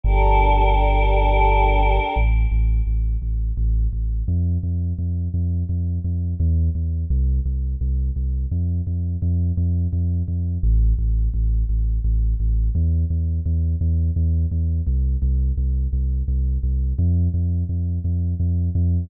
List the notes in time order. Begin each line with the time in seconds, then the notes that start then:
0.04 G1 D4 G4 A4 A#4
2.16 A1
2.51 A1
2.87 A1
3.22 A1
3.57 A1
3.93 A1
4.28 F2
4.63 F2
4.99 F2
5.34 F2
5.69 F2
6.04 F2
6.40 E2
6.75 E2
7.10 C2
7.46 C2
7.81 C2
8.16 C2
8.51 F2
8.87 F2
9.22 F2
9.57 F2
9.93 F2
10.28 F2
10.63 A1
10.99 A1
11.34 A1
11.69 A1
12.04 A1
12.40 A1
12.75 E2
13.10 E2
13.46 E2
13.81 E2
14.16 E2
14.51 E2
14.87 C2
15.22 C2
15.57 C2
15.93 C2
16.28 C2
16.63 C2
16.99 F2
17.34 F2
17.69 F2
18.04 F2
18.40 F2
18.75 F2